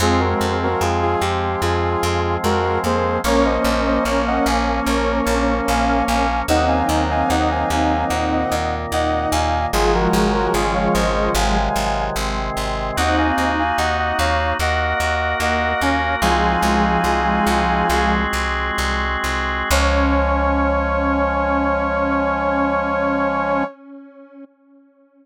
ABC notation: X:1
M:4/4
L:1/16
Q:1/4=74
K:Db
V:1 name="Brass Section"
[FA] [GB]2 [GB] [FA] [FA] =G2 [FA]4 [_GB]2 [Ac]2 | [Bd] [ce]2 [ce] [Bd] [eg] [fa]2 [Bd]4 [fa]2 [fa]2 | [eg] [fa]2 [fa] [eg] [fa] [fa]2 [eg]4 [eg]2 [fa]2 | [FA] [GB]2 [GB] [FA] [df] [ce]2 [fa]4 z4 |
[eg] [fa]2 [fa] [eg] [eg] [df]2 [eg]4 [eg]2 [fa]2 | "^rit." [fa]10 z6 | d16 |]
V:2 name="Lead 1 (square)"
[A,C]4 z8 A,2 B,2 | [B,D]16 | [CE]12 E4 | [F,A,]10 z6 |
[CE]4 z8 B,2 D2 | "^rit." [F,A,]10 z6 | D16 |]
V:3 name="Drawbar Organ"
[F,A,C]16 | [F,B,D]16 | [E,G,B,]8 [B,,E,B,]8 | [D,E,G,A,]4 [D,E,A,D]4 [C,E,G,A,]4 [C,E,A,C]4 |
[B,EG]8 [B,GB]8 | "^rit." [A,CEG]8 [A,CGA]8 | [F,A,D]16 |]
V:4 name="Electric Bass (finger)" clef=bass
F,,2 F,,2 F,,2 F,,2 F,,2 F,,2 F,,2 F,,2 | B,,,2 B,,,2 B,,,2 B,,,2 B,,,2 B,,,2 B,,,2 B,,,2 | E,,2 E,,2 E,,2 E,,2 E,,2 E,,2 E,,2 E,,2 | A,,,2 A,,,2 A,,,2 A,,,2 A,,,2 A,,,2 A,,,2 A,,,2 |
E,,2 E,,2 E,,2 E,,2 E,,2 E,,2 E,,2 E,,2 | "^rit." C,,2 C,,2 C,,2 C,,2 C,,2 C,,2 C,,2 C,,2 | D,,16 |]